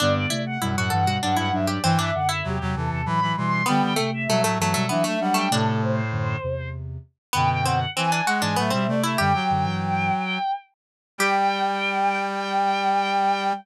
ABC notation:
X:1
M:3/4
L:1/16
Q:1/4=98
K:G
V:1 name="Violin"
d d2 f2 f f2 f f e d | g e f e G2 A A b2 c'2 | g g2 e2 e e2 e e f g | A2 c6 z4 |
g g f2 ^g g f g e2 d e | "^rit." g10 z2 | g12 |]
V:2 name="Harpsichord"
D2 E z E F A F D E2 G | C D2 E5 z4 | B,2 A, z A, A, A, A, B, A,2 A, | D8 z4 |
B,2 C z C D F D B, C2 E | "^rit." G10 z2 | G12 |]
V:3 name="Ocarina"
[D,B,] [D,B,] [C,A,]2 [B,,G,] [A,,F,] [G,,E,] [B,,G,] [F,D]2 [F,D]2 | [G,,E,] [G,,E,] [F,,D,]2 [E,,C,] [E,,C,] [E,,C,] [E,,C,] [A,,F,]2 [B,,G,]2 | [D,B,] [D,B,] [C,A,]2 [B,,G,] [A,,F,] [G,,E,] [B,,G,] [F,D]2 [F,D]2 | [C,A,]4 [F,,D,]2 [E,,C,]4 z2 |
[F,,D,]4 z3 [^G,,E,] [A,,F,] [B,,=G,] [C,A,]2 | "^rit." [F,,D,] z [F,,D,] [G,,E,]3 z6 | G,12 |]
V:4 name="Brass Section"
G,,2 z2 F,, F,, G,,2 G,, G,, G,,2 | E,2 z2 F, F, E,2 E, E, E,2 | G,2 z2 F, F, F,2 E, A, G,2 | A,,6 z6 |
B,,4 E,2 ^G,2 A, =G, A, A, | "^rit." G, F,7 z4 | G,12 |]